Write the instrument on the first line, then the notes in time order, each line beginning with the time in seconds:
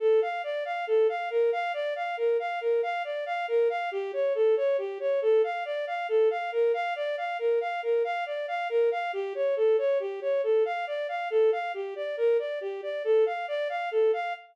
violin
0.00 A4
0.22 F5
0.44 D5
0.65 F5
0.87 A4
1.09 F5
1.30 A#4
1.52 F5
1.74 D5
1.96 F5
2.17 A#4
2.39 F5
2.61 A#4
2.83 F5
3.04 D5
3.26 F5
3.48 A#4
3.70 F5
3.92 G4
4.13 C#5
4.35 A4
4.57 C#5
4.78 G4
5.00 C#5
5.22 A4
5.44 F5
5.65 D5
5.87 F5
6.09 A4
6.31 F5
6.52 A#4
6.74 F5
6.96 D5
7.17 F5
7.39 A#4
7.61 F5
7.83 A#4
8.04 F5
8.26 D5
8.48 F5
8.69 A#4
8.91 F5
9.13 G4
9.35 C#5
9.56 A4
9.78 C#5
10.00 G4
10.21 C#5
10.43 A4
10.65 F5
10.87 D5
11.09 F5
11.30 A4
11.52 F5
11.74 G4
11.96 D5
12.17 A#4
12.39 D5
12.61 G4
12.83 D5
13.04 A4
13.26 F5
13.48 D5
13.69 F5
13.91 A4
14.13 F5